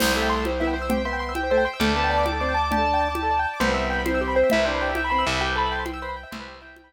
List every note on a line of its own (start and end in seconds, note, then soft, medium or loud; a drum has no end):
0.00 1.68 C2 loud
0.00 0.15 G3 medium
0.00 0.07 G4 medium
0.00 0.12 C5 loud
0.00 1.79 C5 medium
0.00 1.79 E5 medium
0.00 1.79 G5 medium
0.00 crash loud
0.00 low conga loud
0.07 0.13 C5 medium
0.15 0.45 A3 medium
0.15 0.28 E5 medium
0.15 0.22 E5 medium
0.22 0.29 G5 medium
0.29 0.43 C6 medium
0.29 0.37 C6 medium
0.37 0.44 E6 medium
0.45 0.52 G4 medium
0.45 0.61 C5 medium
0.45 high conga medium
0.52 0.59 C5 medium
0.60 0.75 B3 medium
0.60 0.75 E4 medium
0.60 0.67 E5 medium
0.67 0.74 G5 medium
0.74 0.86 C5 medium
0.74 0.83 C6 medium
0.82 0.88 E6 medium
0.89 1.02 C4 medium
0.89 0.97 G4 medium
0.89 1.04 G5 medium
0.89 low conga loud
0.98 1.04 C5 medium
1.05 1.33 B3 medium
1.05 1.12 E5 medium
1.05 1.18 C6 medium
1.13 1.20 G5 medium
1.19 1.34 C6 medium
1.19 1.27 C6 medium
1.29 1.36 E6 medium
1.35 1.42 G4 medium
1.35 1.50 G5 medium
1.35 high conga medium
1.43 1.50 C5 medium
1.50 1.64 A3 medium
1.50 1.64 C5 medium
1.50 1.57 E5 medium
1.58 1.64 G5 medium
1.65 1.80 G5 medium
1.65 1.72 C6 medium
1.73 1.80 E6 medium
1.80 3.46 D2 loud
1.80 1.94 A3 medium
1.80 1.87 G4 loud
1.80 3.59 D5 medium
1.80 3.59 G5 medium
1.80 3.59 A5 loud
1.80 1.94 D6 medium
1.80 low conga loud
1.89 1.95 A4 medium
1.96 2.25 B3 medium
1.96 2.03 D5 medium
1.96 2.10 A5 medium
2.04 2.11 G5 medium
2.10 2.24 D5 medium
2.10 2.18 A5 medium
2.18 2.24 D6 medium
2.25 2.32 G4 medium
2.25 2.39 D6 medium
2.25 high conga medium
2.32 2.39 A4 medium
2.40 2.53 C4 medium
2.40 2.48 D5 medium
2.40 2.55 D6 medium
2.49 2.55 G5 medium
2.54 2.61 A5 medium
2.54 2.69 D6 medium
2.64 2.71 D6 medium
2.71 3.08 D4 medium
2.71 2.79 G4 medium
2.71 3.39 A5 loud
2.71 low conga loud
2.78 2.84 A4 medium
2.85 2.92 D5 medium
2.94 3.00 G5 medium
3.01 3.08 A5 medium
3.09 3.15 D6 medium
3.15 3.22 G4 medium
3.15 high conga medium
3.23 3.30 A4 medium
3.31 3.38 D5 medium
3.39 3.46 G5 medium
3.45 3.52 A5 medium
3.54 3.61 D6 medium
3.60 4.43 C2 loud
3.60 4.03 B3 medium
3.60 3.68 G4 loud
3.60 5.39 B4 medium
3.60 3.72 C5 medium
3.60 5.39 C5 medium
3.60 5.39 E5 medium
3.60 5.39 G5 medium
3.60 low conga loud
3.69 3.75 B4 loud
3.74 3.82 C5 medium
3.74 3.87 E5 medium
3.84 3.91 E5 medium
3.90 3.97 G5 medium
3.90 4.07 B5 medium
3.99 4.05 B5 medium
4.05 4.49 C4 medium
4.05 4.20 C5 medium
4.05 4.12 C6 medium
4.05 high conga loud
4.14 4.21 E6 medium
4.21 4.35 G4 medium
4.21 4.28 C6 medium
4.28 4.35 B5 medium
4.35 4.51 C5 medium
4.35 4.42 G5 medium
4.43 4.50 E5 medium
4.50 5.24 C2 medium
4.50 4.64 E4 medium
4.50 4.59 C5 medium
4.50 4.66 E5 loud
4.50 low conga loud
4.58 4.65 B4 medium
4.65 4.91 D4 medium
4.65 4.72 G4 medium
4.65 4.79 C5 medium
4.74 4.81 B4 medium
4.81 4.96 G4 medium
4.81 4.88 C5 medium
4.89 4.96 E5 medium
4.95 5.12 E5 medium
4.95 5.03 G5 medium
4.95 high conga medium
5.04 5.11 B5 medium
5.10 5.25 C4 medium
5.10 5.24 B5 medium
5.10 5.18 C6 medium
5.19 5.25 E6 medium
5.26 6.25 C2 loud
5.26 5.39 E5 medium
5.26 5.33 C6 medium
5.34 5.40 B5 medium
5.40 5.47 G4 loud
5.40 5.55 G4 medium
5.40 6.93 B4 medium
5.40 6.93 C5 medium
5.40 6.93 E5 medium
5.40 5.55 G5 loud
5.40 6.93 G5 medium
5.48 5.55 B4 medium
5.56 5.84 A4 medium
5.56 5.63 C5 medium
5.56 5.72 B5 loud
5.65 5.72 E5 medium
5.71 5.78 G5 medium
5.71 5.86 C6 medium
5.79 5.86 B5 medium
5.85 6.00 G5 medium
5.85 5.92 C6 medium
5.85 high conga loud
5.94 6.00 E6 loud
6.02 6.15 B4 medium
6.02 6.15 C5 medium
6.02 6.09 C6 loud
6.09 6.16 B5 medium
6.16 6.23 G5 medium
6.16 6.29 G5 medium
6.23 6.30 E5 medium
6.31 6.93 C2 medium
6.31 6.38 C5 medium
6.31 6.59 C5 medium
6.31 6.59 E5 medium
6.31 low conga loud
6.40 6.47 B4 loud
6.48 6.54 G4 medium
6.54 6.61 B4 medium
6.60 6.75 E4 medium
6.60 6.67 C5 medium
6.60 6.76 G5 medium
6.68 6.75 E5 medium
6.76 6.93 G5 medium
6.76 6.84 G5 medium
6.76 high conga loud
6.84 6.91 B5 medium